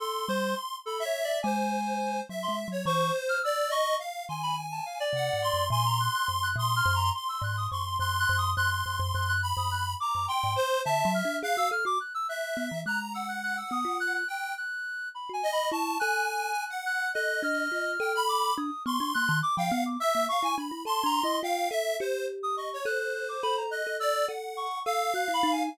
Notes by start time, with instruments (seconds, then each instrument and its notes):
0.00 clarinet A4, lead 1 (square) C6
0.28 kalimba G3, clarinet C5
0.86 clarinet A4, lead 1 (square) B5
1.00 lead 1 (square) E5
1.05 clarinet C#5
1.24 clarinet D5
1.43 kalimba G#3, lead 1 (square) C5, clarinet G#5
2.29 kalimba F#3, lead 1 (square) E5
2.43 clarinet C6
2.48 kalimba G#3
2.68 kalimba F#3, lead 1 (square) C#5
2.85 kalimba E3, lead 1 (square) C5, clarinet C#6
3.29 clarinet F6
3.43 lead 1 (square) D5, clarinet E6
3.70 lead 1 (square) D#5, clarinet C#6
3.99 lead 1 (square) F5
4.29 kalimba D#3, lead 1 (square) G#5, clarinet C6
4.43 clarinet B5
4.71 clarinet A5
4.86 clarinet F5
5.00 clarinet D5
5.13 kalimba C3, lead 1 (square) F#5
5.33 kalimba G#2
5.42 lead 1 (square) C6
5.53 kalimba F#2
5.70 kalimba A#2, clarinet G#5, lead 1 (square) C6
5.86 clarinet A#5
6.00 clarinet F#6
6.14 clarinet F#6
6.28 kalimba F#2
6.43 clarinet F#6
6.56 kalimba A#2, lead 1 (square) C6, clarinet D#6
6.76 clarinet F6
6.85 kalimba F#2
6.95 clarinet A#5
7.14 clarinet C6, lead 1 (square) C6
7.29 clarinet E6
7.42 kalimba G#2, clarinet F#6
7.57 clarinet D#6
7.71 kalimba F#2, lead 1 (square) C6, clarinet C#6
7.86 clarinet C6
7.99 kalimba F#2, lead 1 (square) C6, clarinet F#6
8.19 clarinet F#6
8.29 kalimba F#2
8.38 clarinet D#6
8.56 kalimba F#2, lead 1 (square) C6, clarinet F#6
8.71 clarinet F#6
8.86 kalimba F#2, clarinet F#6
9.00 kalimba F#2
9.14 kalimba F#2, clarinet F#6
9.28 clarinet F#6
9.42 lead 1 (square) B5
9.57 kalimba F#2, clarinet D#6
9.71 clarinet F#6
10.00 lead 1 (square) A#5, clarinet D6
10.15 kalimba F#2
10.28 lead 1 (square) G5, clarinet C6
10.44 kalimba G#2
10.56 lead 1 (square) C5
10.85 kalimba D3, lead 1 (square) E5, clarinet A5
11.05 kalimba F#3
11.14 clarinet F6
11.25 kalimba D4
11.43 kalimba G#4, lead 1 (square) F5, clarinet F#6
11.57 kalimba F#4, clarinet E6
11.71 kalimba A4, clarinet F6
11.85 kalimba F#4, clarinet D6
12.00 clarinet F#6
12.14 clarinet E6
12.29 lead 1 (square) E5, clarinet F#6
12.57 kalimba B3
12.71 kalimba E3
12.86 kalimba G#3, lead 1 (square) A#5, clarinet F#6
13.13 lead 1 (square) F#5, clarinet E6
13.28 clarinet F#6
13.43 clarinet F#6
13.57 clarinet E6
13.71 kalimba B3, clarinet D#6
13.85 kalimba F4
14.00 clarinet F#6
14.15 clarinet F#6
14.28 lead 1 (square) G5, clarinet F#6
14.57 clarinet F#6
15.15 clarinet B5
15.29 kalimba F#4, clarinet G#5
15.43 lead 1 (square) D#5
15.53 clarinet B5
15.71 kalimba E4, lead 1 (square) A5, clarinet C#6
15.99 kalimba A4, lead 1 (square) G#5, clarinet F#6
16.29 clarinet F#6
16.70 lead 1 (square) F#5
16.86 clarinet F#6
17.14 kalimba A4, lead 1 (square) D#5, clarinet F#6
17.43 kalimba D4, clarinet F6
17.72 kalimba F4
18.00 kalimba A4, lead 1 (square) G5
18.15 lead 1 (square) B5
18.29 clarinet D6
18.57 kalimba D4, clarinet D#6
18.86 kalimba B3, lead 1 (square) C6, clarinet C#6
19.00 kalimba D4
19.14 kalimba A#3, clarinet F#6
19.29 kalimba D#3
19.43 clarinet D6
19.57 kalimba F3, lead 1 (square) F5, clarinet G5
19.71 kalimba B3, clarinet F#5
19.86 clarinet D6
20.00 lead 1 (square) E5, clarinet E6
20.15 kalimba A#3
20.29 lead 1 (square) F5, clarinet C#6
20.43 kalimba E4, lead 1 (square) G#5
20.57 kalimba D4, lead 1 (square) B5
20.71 kalimba E4
20.85 kalimba A4, clarinet A5, lead 1 (square) C6
21.04 kalimba D4, clarinet A#5
21.23 kalimba E4, clarinet D#5
21.43 kalimba F4, lead 1 (square) F5, clarinet G5
21.70 kalimba A4, lead 1 (square) E5
22.00 kalimba G4, lead 1 (square) C5
22.43 clarinet D#6
22.57 lead 1 (square) D#5, clarinet C#6
22.73 lead 1 (square) C#5
22.85 kalimba A4, lead 1 (square) C5, clarinet F#6
23.00 clarinet F#6
23.14 clarinet F#6
23.29 clarinet D6
23.43 kalimba A4, clarinet B5
23.57 clarinet A#5
23.71 lead 1 (square) D#5, clarinet F#6
23.87 kalimba A4
24.00 lead 1 (square) D5, clarinet E6
24.28 kalimba A4, lead 1 (square) F#5
24.57 clarinet C#6
24.85 kalimba A4, lead 1 (square) F5, clarinet E6
25.14 kalimba F#4, clarinet F#6
25.28 kalimba E4
25.34 clarinet B5
25.43 kalimba D#4
25.52 clarinet G#5